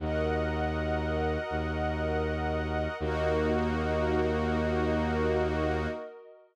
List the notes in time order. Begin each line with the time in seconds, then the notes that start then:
0.00 D#2 F#4 A#4 D#5 F#5
1.50 D#2
3.00 D#2 A#3 D#4 F#4 A#4 D#5